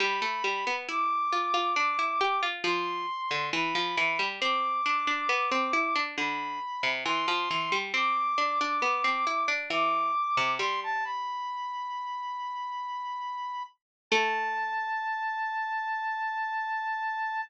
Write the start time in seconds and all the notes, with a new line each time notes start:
0.00 G3 B5
0.22 A3
0.44 G3
0.67 B3
0.89 E4 D6
1.33 F4
1.54 F4
1.76 D4
1.99 E4
2.21 G4
2.43 F4
2.64 F3 C6
3.31 D3
3.53 E3 B5
3.75 F3
3.97 E3
4.19 G3
4.40 C4 D6
4.86 D4
5.07 D4
5.29 B3
5.51 C4
5.73 E4
5.96 D4
6.18 D3 B5
6.83 C3
7.05 E3 C6
7.28 F3
7.51 E3
7.72 G3
7.94 C4 D6
8.38 D4
8.61 D4
8.82 B3
9.04 C4
9.27 E4
9.48 D4
9.70 E3 D6
10.37 C3
10.59 G3 C6
10.83 A5
11.04 B5
14.11 A3 A5